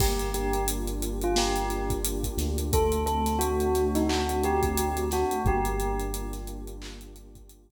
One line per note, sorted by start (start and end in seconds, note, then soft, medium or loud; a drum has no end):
0.00 2.28 G1 medium
0.00 1.36 A#3 loud
0.00 0.29 G4 loud
0.00 kick medium
0.00 crash medium
0.19 closed hi-hat medium
0.34 1.69 D4 medium
0.34 0.64 G4 medium
0.34 closed hi-hat medium
0.53 closed hi-hat medium
0.68 2.03 F4 medium
0.68 closed hi-hat loud
0.87 closed hi-hat medium
1.02 2.38 G4 medium
1.02 closed hi-hat medium
1.21 1.37 F4 loud
1.21 closed hi-hat medium
1.36 2.67 A#3 medium
1.36 1.82 G4 loud
1.36 snare loud
1.56 closed hi-hat medium
1.70 2.68 D4 medium
1.70 closed hi-hat medium
1.90 kick medium
1.90 closed hi-hat medium
2.04 2.69 F4 medium
2.04 closed hi-hat medium
2.24 kick medium
2.24 closed hi-hat medium
2.37 5.24 D2 loud
2.37 2.72 G4 medium
2.37 snare soft
2.37 closed hi-hat medium
2.58 closed hi-hat medium
2.72 4.09 A3 loud
2.72 3.02 A4 loud
2.72 kick medium
2.72 closed hi-hat medium
2.92 closed hi-hat medium
3.06 4.42 C4 medium
3.06 3.37 A4 loud
3.06 closed hi-hat medium
3.26 snare soft
3.26 closed hi-hat medium
3.39 4.76 D4 medium
3.39 3.87 F#4 loud
3.39 closed hi-hat medium
3.60 closed hi-hat medium
3.75 5.11 F#4 medium
3.75 snare soft
3.75 closed hi-hat medium
3.95 4.09 D#4 medium
3.95 snare soft
3.95 closed hi-hat medium
4.09 5.40 A3 medium
4.09 4.39 F#4 loud
4.09 clap medium
4.29 closed hi-hat medium
4.42 5.40 C4 medium
4.42 5.03 G4 loud
4.42 closed hi-hat medium
4.63 kick medium
4.63 closed hi-hat medium
4.77 5.42 D4 medium
4.77 closed hi-hat medium
4.97 closed hi-hat medium
5.11 5.44 F#4 medium
5.11 5.41 F#4 loud
5.11 snare soft
5.11 closed hi-hat medium
5.31 closed hi-hat medium
5.45 7.71 G1 loud
5.45 6.83 A#3 loud
5.45 6.33 G4 loud
5.45 kick medium
5.45 closed hi-hat soft
5.65 closed hi-hat medium
5.79 7.15 D4 medium
5.79 closed hi-hat medium
6.00 closed hi-hat medium
6.13 7.50 F4 medium
6.13 closed hi-hat medium
6.33 snare soft
6.33 closed hi-hat medium
6.47 7.71 G4 medium
6.47 closed hi-hat medium
6.67 closed hi-hat medium
6.82 7.71 A#3 medium
6.82 clap loud
7.01 closed hi-hat medium
7.16 7.71 D4 medium
7.16 closed hi-hat medium
7.35 kick medium
7.35 closed hi-hat medium
7.49 7.71 F4 medium
7.49 closed hi-hat medium
7.70 kick medium
7.70 closed hi-hat medium